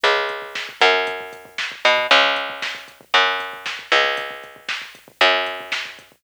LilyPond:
<<
  \new Staff \with { instrumentName = "Electric Bass (finger)" } { \clef bass \time 4/4 \key cis \minor \tempo 4 = 116 cis,4. fis,2 b,8 | cis,2 fis,4. cis,8~ | cis,2 fis,2 | }
  \new DrumStaff \with { instrumentName = "Drums" } \drummode { \time 4/4 <hh bd>16 bd16 <hh bd>16 bd16 <bd sn>16 bd16 <hh bd>16 bd16 <hh bd>16 bd16 <hh bd>16 bd16 <bd sn>16 bd16 <hho bd>16 bd16 | <hh bd>16 bd16 <hh bd>16 bd16 <bd sn>16 bd16 <hh bd>16 bd16 <hh bd>16 bd16 <hh bd>16 bd16 <bd sn>16 bd16 <hh bd>16 bd16 | <hh bd>16 bd16 <hh bd>16 bd16 <bd sn>16 bd16 <hh bd>16 bd16 <hh bd>16 bd16 <hh bd>16 bd16 <bd sn>16 bd16 <hh bd>16 bd16 | }
>>